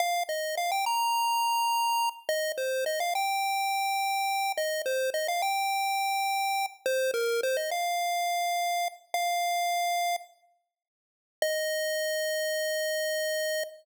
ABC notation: X:1
M:4/4
L:1/16
Q:1/4=105
K:Eb
V:1 name="Lead 1 (square)"
f2 e2 f g b10 | e2 c2 e f g10 | e2 c2 e f g10 | c2 B2 c e f10 |
f8 z8 | e16 |]